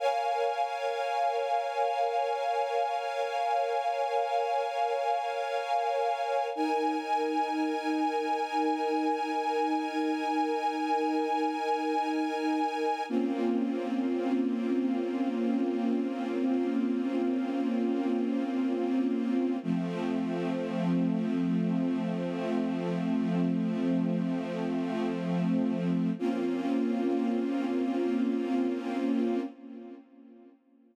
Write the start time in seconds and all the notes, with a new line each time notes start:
0.00 A#4 C#5 F5 G#5
6.55 D#4 A#4 G#5
13.09 A#3 C4 C#4 F4
19.63 F3 A3 C4
26.19 A#3 C4 C#4 F4